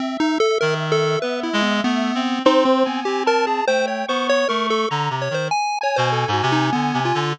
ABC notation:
X:1
M:6/4
L:1/16
Q:1/4=98
K:none
V:1 name="Lead 1 (square)"
(3C2 ^D2 A2 ^A z =A2 (3B2 E2 B,2 B,4 (3D2 C2 B,2 (3G2 ^A2 ^G2 | (3c2 ^c2 =c2 (3^c2 ^A2 =A2 z2 c =c ^g2 ^c =c (3A2 ^F2 ^D2 B,2 =F2 |]
V:2 name="Clarinet"
z4 ^D,4 B,2 ^G,2 A,2 C2 C4 C4 | (3A,4 B,4 A,4 (3D,2 C,2 ^D,2 z3 B,,2 ^G,, C,2 (3=D,2 C,2 D,2 |]
V:3 name="Lead 1 (square)"
e16 (3c4 ^g4 a4 | (3g4 ^c'4 c'4 ^a2 z4 ^g10 |]